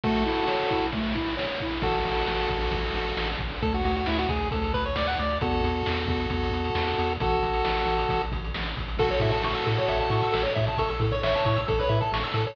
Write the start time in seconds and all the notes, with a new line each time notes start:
0.04 A3 F#4 A4, kick, ride
0.25 E4, ride
0.47 C#5, snare
0.70 E4, kick, ride
0.92 A3, kick, ride
1.15 E4, kick, ride
1.37 C#5, snare
1.60 E4, kick, ride
1.82 A1 F#4 A4, kick, crash
1.94 closed hi-hat
2.05 A1, closed hi-hat
2.16 closed hi-hat
2.27 A1, snare
2.39 closed hi-hat
2.50 A1, kick, closed hi-hat
2.61 closed hi-hat
2.71 A1, kick, closed hi-hat
2.84 closed hi-hat
2.94 A1, closed hi-hat
3.06 closed hi-hat
3.17 A1, snare
3.29 closed hi-hat
3.38 A1, kick, closed hi-hat
3.51 open hi-hat
3.62 D2 A4, kick, closed hi-hat
3.73 F#4, closed hi-hat
3.84 D2 F#4, closed hi-hat
3.95 F#4, closed hi-hat
4.06 D2 E4, snare
4.18 F#4, closed hi-hat
4.29 D2 G#4, kick, closed hi-hat
4.40 closed hi-hat
4.51 D2 A4, kick, closed hi-hat
4.63 closed hi-hat
4.74 D2 B4, kick, closed hi-hat
4.85 C#5, closed hi-hat
4.96 D2 D5, snare
5.07 F#5, closed hi-hat
5.18 D2 D5, closed hi-hat
5.29 closed hi-hat
5.41 E2 F#4 A4, kick, closed hi-hat
5.52 closed hi-hat
5.64 E2, closed hi-hat
5.75 closed hi-hat
5.86 E2, snare
5.97 closed hi-hat
6.07 E2, kick, closed hi-hat
6.19 closed hi-hat
6.30 E2, kick, closed hi-hat
6.43 closed hi-hat
6.51 E2, closed hi-hat
6.64 closed hi-hat
6.75 E2, snare
6.87 closed hi-hat
6.98 E2, closed hi-hat
7.09 closed hi-hat
7.20 A1 F#4 A4, kick, closed hi-hat
7.31 closed hi-hat
7.43 A1, closed hi-hat
7.53 closed hi-hat
7.65 A1, snare
7.76 closed hi-hat
7.86 A1, closed hi-hat
7.98 closed hi-hat
8.09 A1, kick, closed hi-hat
8.21 closed hi-hat
8.32 A1, kick, closed hi-hat
8.44 closed hi-hat
8.54 A1, snare
8.65 closed hi-hat
8.77 A1, kick, closed hi-hat
8.88 closed hi-hat
8.97 A1 F#4 A4, kick, crash
9.11 C#5, closed hi-hat
9.20 A2 E5, kick, closed hi-hat
9.32 A5, closed hi-hat
9.42 A1 C#6, snare
9.55 E6, closed hi-hat
9.66 A2 A4, closed hi-hat
9.77 C#5, closed hi-hat
9.88 A1 E5, kick, closed hi-hat
10.00 A5, closed hi-hat
10.10 A2 C#6, closed hi-hat
10.23 E6, closed hi-hat
10.32 A1 A4, snare
10.43 C#5, closed hi-hat
10.55 A2 E5, kick, closed hi-hat
10.67 A5, closed hi-hat
10.78 A1 A4 C#6, kick, closed hi-hat
10.89 A4 E6, closed hi-hat
11.00 A2 A4, kick, closed hi-hat
11.11 C#5, closed hi-hat
11.23 A1 C#5 E5, snare
11.34 A5, closed hi-hat
11.45 A2 C#6, kick, closed hi-hat
11.56 E6, closed hi-hat
11.68 A1 A4, kick, closed hi-hat
11.79 B4 C#5, closed hi-hat
11.89 A2 E5, closed hi-hat
12.00 A4 A5, closed hi-hat
12.12 A1 C#6, snare
12.23 E6, closed hi-hat
12.34 A2 A4, closed hi-hat
12.47 A4 C#5, closed hi-hat